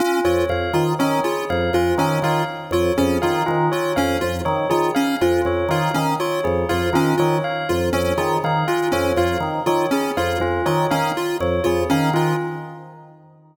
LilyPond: <<
  \new Staff \with { instrumentName = "Drawbar Organ" } { \clef bass \time 5/4 \tempo 4 = 121 r8 f,8 f,8 dis8 dis8 r8 f,8 f,8 dis8 dis8 | r8 f,8 f,8 dis8 dis8 r8 f,8 f,8 dis8 dis8 | r8 f,8 f,8 dis8 dis8 r8 f,8 f,8 dis8 dis8 | r8 f,8 f,8 dis8 dis8 r8 f,8 f,8 dis8 dis8 |
r8 f,8 f,8 dis8 dis8 r8 f,8 f,8 dis8 dis8 | }
  \new Staff \with { instrumentName = "Lead 1 (square)" } { \time 5/4 cis'8 f'8 r8 f'8 cis'8 f'8 r8 f'8 cis'8 f'8 | r8 f'8 cis'8 f'8 r8 f'8 cis'8 f'8 r8 f'8 | cis'8 f'8 r8 f'8 cis'8 f'8 r8 f'8 cis'8 f'8 | r8 f'8 cis'8 f'8 r8 f'8 cis'8 f'8 r8 f'8 |
cis'8 f'8 r8 f'8 cis'8 f'8 r8 f'8 cis'8 f'8 | }
  \new Staff \with { instrumentName = "Tubular Bells" } { \time 5/4 f'8 cis''8 f''8 r8 cis''8 gis'8 f''8 f'8 cis''8 f''8 | r8 cis''8 gis'8 f''8 f'8 cis''8 f''8 r8 cis''8 gis'8 | f''8 f'8 cis''8 f''8 r8 cis''8 gis'8 f''8 f'8 cis''8 | f''8 r8 cis''8 gis'8 f''8 f'8 cis''8 f''8 r8 cis''8 |
gis'8 f''8 f'8 cis''8 f''8 r8 cis''8 gis'8 f''8 f'8 | }
>>